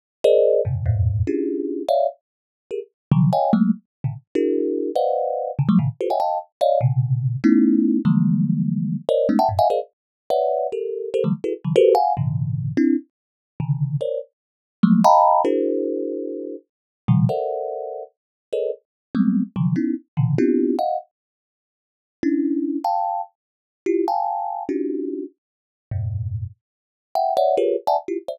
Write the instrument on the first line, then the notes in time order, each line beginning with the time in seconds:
kalimba
0.24 G#4 A#4 C5 D5 D#5
0.65 F2 G2 A2 B2 C3 C#3
0.86 E2 F2 G2 G#2 A2 A#2
1.27 C#4 D4 E4 F4 G4 G#4
1.88 C#5 D5 E5 F5
2.71 G4 G#4 A#4
3.12 C3 D3 D#3 F3 F#3
3.33 C#5 D#5 F5 G5 G#5
3.53 F#3 G#3 A3 A#3
4.04 A2 B2 C3 C#3 D3
4.35 D4 E4 F#4 G#4 A#4
4.95 B4 C5 D5 D#5 F5 F#5
5.59 C3 C#3 D3
5.69 F3 F#3 G3 A3
5.79 A2 A#2 C3 C#3 D#3
6.01 F4 F#4 G4 A4 B4 C5
6.10 C#5 D#5 E5 F#5 G5 G#5
6.20 D#5 F5 G5 A5
6.61 C#5 D5 D#5 F5
6.81 A#2 B2 C3 C#3
7.44 A3 B3 C#4 D#4 E4
8.05 D3 E3 F3 G3 G#3 A#3
9.09 A#4 C5 C#5 D5 D#5
9.29 G#3 A3 B3 C#4 D#4
9.39 E5 F#5 G5 A5
9.49 F#2 G2 A2
9.59 D#5 E5 F5 F#5 G#5
9.70 G#4 A#4 C5 D5 D#5 F5
10.30 B4 C#5 D5 E5 F#5
10.72 G4 A4 A#4
11.14 G4 A4 A#4 C5
11.24 D3 E3 F#3 G3 A3
11.44 E4 F#4 G#4 A4 B4
11.64 C#3 D#3 E3 F#3
11.76 F#4 G4 A4 A#4 B4 C5
11.95 F5 F#5 G#5
12.17 G#2 A#2 C3 C#3 D3 E3
12.77 C4 D4 E4
13.60 C3 C#3 D3 D#3
14.01 A#4 C5 C#5 D5
14.83 F3 F#3 G#3 A3 A#3
15.04 D#5 F5 G5 A5 A#5 B5
15.45 D4 E4 F#4 G#4 A#4 C5
17.08 A#2 B2 C#3 D#3 F3 G3
17.29 A4 A#4 C5 D5 E5 F#5
18.53 G#4 A4 A#4 B4 C#5 D#5
19.15 F#3 G3 G#3 A3 B3 C4
19.56 C3 D3 E3 F3 F#3
19.76 B3 C#4 D#4 E4
20.17 A#2 B2 C#3 D3 E3
20.38 B3 C4 D4 E4 F4 G4
20.79 D#5 F5 F#5
22.23 C#4 D4 E4
22.84 F5 G5 A5
23.86 E4 F4 G4
24.08 F5 G5 G#5 A5
24.69 C#4 D4 D#4 F4 F#4 G4
25.91 F2 G2 G#2 A2 B2
27.15 E5 F#5 G5
27.37 C#5 D5 E5 F#5
27.57 F4 G4 G#4 A#4 B4 C#5
27.87 D5 E5 F#5 G#5 A5
28.08 E4 F4 G4
28.28 C5 D5 E5